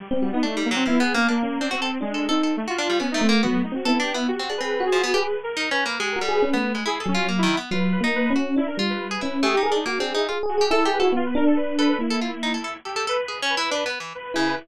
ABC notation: X:1
M:2/4
L:1/16
Q:1/4=140
K:none
V:1 name="Electric Piano 1"
z C _G _E3 z2 | (3B,4 _B,4 _D4 | (3C4 D4 _E4 | z4 B,2 A,2 |
(3_G,2 A,2 C2 B,4 | G z _A3 _G3 | _A2 z6 | (3G2 _G2 _A2 _D =A,3 |
z2 _G,4 z2 | (3_G,4 _B,4 _D4 | D2 G,4 _D2 | G z _A z (3_G2 A2 A2 |
(3_A2 A2 A2 (3E2 A2 _G2 | B,2 D6 | _B,6 z2 | z8 |
z6 E2 |]
V:2 name="Orchestral Harp"
z4 (3D2 G,2 _G,2 | (3F,2 B,2 _B,2 D z2 C | _G A z2 (3A2 A2 A2 | z _G D =G, (3B,2 A,2 _B,2 |
_G2 z2 (3A2 D2 B,2 | z C D C3 F, B, | G z3 (3_E2 _D2 _B,2 | _A,2 G,3 B,2 A, |
(3E2 A2 F2 (3_B,2 _E,2 =B,2 | F3 _E3 _G2 | z2 F3 _A E2 | (3A,2 _E2 D2 (3_B,2 C2 E2 |
F z2 G (3A2 G2 A2 | z6 A2 | z A F z _E A A z | A A A z (3_A2 _D2 E2 |
(3D2 B,2 E,2 z2 _D,2 |]
V:3 name="Lead 2 (sawtooth)"
G, G, G, B, A,2 _B, C | (3E2 _A2 _D2 _B,3 =D | (3C4 _A,4 C4 | A, F3 _D _E C z |
B,2 _E _G (3=E2 =G2 E2 | (3_G4 B4 _A4 | (3B4 _B4 =B4 | _A _B =A =B B4 |
_A2 _D2 _B, E2 z | B2 B z B2 z2 | E _B z =B B4 | _A G _B _E z D2 =E |
z2 _G2 A2 B E | F B _B A =B2 B B | E8 | G2 B2 B z B2 |
B2 z2 B3 B |]